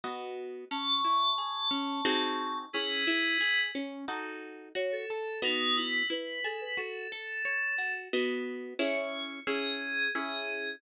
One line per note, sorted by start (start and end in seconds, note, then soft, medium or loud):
0.04 0.65 B3 medium
0.04 0.65 F#4 medium
0.04 0.65 D#5 medium
0.71 1.01 C#4 medium
0.71 2.57 A5 loud
0.71 2.57 C#6 loud
1.04 1.35 E4 medium
1.38 1.69 G#4 medium
1.71 2.01 C#4 medium
2.05 2.66 C4 medium
2.05 2.66 D#4 medium
2.05 2.66 F#4 medium
2.05 2.66 G#4 medium
2.73 3.05 C#4 medium
2.73 3.59 E4 loud
2.73 3.59 G#4 loud
3.07 3.38 E4 medium
3.41 3.71 G#4 medium
3.75 4.05 C#4 medium
4.08 4.69 D#4 medium
4.08 4.69 F#4 medium
4.08 4.69 A4 medium
4.75 5.05 F#4 medium
4.75 4.92 C#5 loud
4.92 5.08 A4 loud
5.09 5.38 A4 loud
5.09 5.40 A4 medium
5.42 6.03 B3 loud
5.42 5.76 D#4 loud
5.42 6.03 F#4 medium
5.42 6.03 D#5 medium
5.77 6.05 E4 loud
6.10 6.40 E4 medium
6.10 6.43 B4 loud
6.44 6.75 G#4 medium
6.44 6.60 A4 loud
6.61 6.77 B4 loud
6.77 7.08 F#4 medium
6.77 7.09 A4 loud
7.11 7.93 A4 loud
7.11 7.42 A4 medium
7.45 7.75 C#5 medium
7.78 8.09 F#4 medium
8.13 8.74 B3 medium
8.13 8.74 F#4 medium
8.13 8.74 D#5 medium
8.79 9.40 C#4 loud
8.79 9.40 E4 loud
8.79 9.40 G#4 loud
8.79 8.96 C#5 medium
8.97 9.38 C#5 medium
9.47 10.08 C#4 medium
9.47 10.08 E4 medium
9.47 10.08 G#4 medium
9.47 10.09 G#4 medium
10.15 10.76 C#4 medium
10.15 10.76 E4 medium
10.15 10.69 G#4 medium
10.15 10.76 G#4 medium